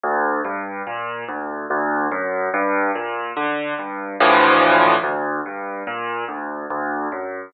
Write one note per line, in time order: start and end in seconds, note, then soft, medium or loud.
0.03 0.41 D2 loud
0.45 0.82 G2 medium
0.87 1.24 A#2 medium
1.28 1.66 D2 medium
1.70 2.08 D2 loud
2.11 2.49 F#2 medium
2.54 2.91 G2 loud
2.95 3.33 A#2 medium
3.36 3.74 D3 medium
3.79 4.16 G2 medium
4.20 4.95 D2 loud
4.20 4.95 A2 medium
4.20 4.95 E3 loud
4.20 4.95 F3 loud
5.03 5.41 D2 medium
5.46 5.83 G2 medium
5.87 6.24 A#2 medium
6.28 6.66 D2 medium
6.70 7.08 D2 medium
7.12 7.49 F#2 medium